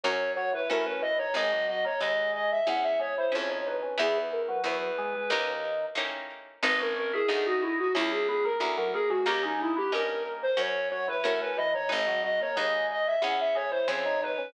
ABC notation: X:1
M:4/4
L:1/16
Q:1/4=91
K:G#m
V:1 name="Flute"
c2 c B A B d c | d2 d c d2 d e f e c ^B c c =B2 | G B A B B6 z6 | B A A G G F E F E G G A z A G F |
=G D E G A2 z ^B c2 c =B A B d c | d2 d c d2 d e f e c ^B c c =B2 |]
V:2 name="Drawbar Organ"
z2 F, E, E, C, E, D, | G, F, F, A, G,4 z2 G, E, C, D, D, C, | E,3 F,3 G, G, D,4 z4 | D C C E D4 z2 B, A, A, F, A, G, |
A, G, G, B, A,4 z2 F, E, E, C, E, D, | G, F, F, A, G,4 z2 G, E, C, D, D, C, |]
V:3 name="Harpsichord"
[CFA]4 [CFA]4 | [DGB]4 [DGB]4 [CEG]4 [CEG]4 | [B,EG]4 [B,EG]4 [A,CD=G]4 [A,CDG]4 | [B,DG]4 [B,DG]4 [CEG]4 [CEG]4 |
[CD=GA]4 [CDGA]4 [CFA]4 [CFA]4 | [DGB]4 [DGB]4 [CEG]4 [CEG]4 |]
V:4 name="Harpsichord" clef=bass
F,,4 =A,,4 | G,,,4 D,,4 E,,4 ^E,,4 | E,,4 E,,4 D,,4 =A,,4 | G,,,4 =D,,4 C,,4 D,,4 |
D,,4 =G,,4 F,,4 =A,,4 | G,,,4 D,,4 E,,4 ^E,,4 |]